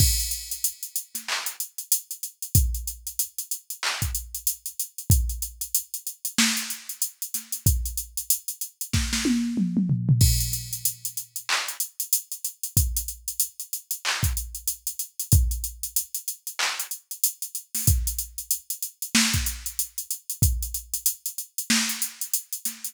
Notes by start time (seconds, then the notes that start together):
0.00 kick, crash
0.20 closed hi-hat
0.31 closed hi-hat
0.51 closed hi-hat
0.64 closed hi-hat
0.83 closed hi-hat
0.96 closed hi-hat
1.15 snare, closed hi-hat
1.28 clap
1.46 closed hi-hat
1.60 closed hi-hat
1.78 closed hi-hat
1.92 closed hi-hat
2.11 closed hi-hat
2.23 closed hi-hat
2.42 closed hi-hat
2.55 kick, closed hi-hat
2.74 closed hi-hat
2.87 closed hi-hat
3.07 closed hi-hat
3.19 closed hi-hat
3.38 closed hi-hat
3.51 closed hi-hat
3.70 closed hi-hat
3.83 clap
4.02 kick, closed hi-hat
4.15 closed hi-hat
4.35 closed hi-hat
4.47 closed hi-hat
4.66 closed hi-hat
4.80 closed hi-hat
4.98 closed hi-hat
5.10 kick, closed hi-hat
5.29 closed hi-hat
5.42 closed hi-hat
5.61 closed hi-hat
5.74 closed hi-hat
5.94 closed hi-hat
6.07 closed hi-hat
6.25 closed hi-hat
6.38 snare
6.57 closed hi-hat
6.70 closed hi-hat
6.89 closed hi-hat
7.02 closed hi-hat
7.22 closed hi-hat
7.34 snare, closed hi-hat
7.52 closed hi-hat
7.66 kick, closed hi-hat
7.86 closed hi-hat
7.97 closed hi-hat
8.17 closed hi-hat
8.30 closed hi-hat
8.48 closed hi-hat
8.61 closed hi-hat
8.81 closed hi-hat
8.93 kick, snare
9.13 snare
9.25 high tom
9.57 mid tom
9.77 mid tom
9.89 floor tom
10.09 floor tom
10.21 kick, crash
10.40 closed hi-hat
10.53 closed hi-hat
10.73 closed hi-hat
10.85 closed hi-hat
11.05 closed hi-hat
11.17 closed hi-hat
11.36 closed hi-hat
11.49 clap
11.68 closed hi-hat
11.80 closed hi-hat
12.00 closed hi-hat
12.13 closed hi-hat
12.32 closed hi-hat
12.45 closed hi-hat
12.63 closed hi-hat
12.77 kick, closed hi-hat
12.97 closed hi-hat
13.08 closed hi-hat
13.28 closed hi-hat
13.40 closed hi-hat
13.60 closed hi-hat
13.73 closed hi-hat
13.91 closed hi-hat
14.05 clap
14.23 kick, closed hi-hat
14.37 closed hi-hat
14.55 closed hi-hat
14.68 closed hi-hat
14.87 closed hi-hat
14.99 closed hi-hat
15.20 closed hi-hat
15.32 kick, closed hi-hat
15.51 closed hi-hat
15.64 closed hi-hat
15.83 closed hi-hat
15.96 closed hi-hat
16.14 closed hi-hat
16.28 closed hi-hat
16.47 closed hi-hat
16.59 clap
16.80 closed hi-hat
16.91 closed hi-hat
17.11 closed hi-hat
17.24 closed hi-hat
17.42 closed hi-hat
17.55 closed hi-hat
17.75 snare, open hi-hat
17.87 kick, closed hi-hat
18.07 closed hi-hat
18.18 closed hi-hat
18.38 closed hi-hat
18.51 closed hi-hat
18.70 closed hi-hat
18.82 closed hi-hat
19.02 closed hi-hat
19.15 snare
19.34 kick, closed hi-hat
19.46 closed hi-hat
19.66 closed hi-hat
19.79 closed hi-hat
19.98 closed hi-hat
20.11 closed hi-hat
20.30 closed hi-hat
20.42 kick, closed hi-hat
20.63 closed hi-hat
20.74 closed hi-hat
20.94 closed hi-hat
21.06 closed hi-hat
21.26 closed hi-hat
21.38 closed hi-hat
21.58 closed hi-hat
21.70 snare
21.89 closed hi-hat
22.02 closed hi-hat
22.21 closed hi-hat
22.34 closed hi-hat
22.53 closed hi-hat
22.65 snare, closed hi-hat
22.84 closed hi-hat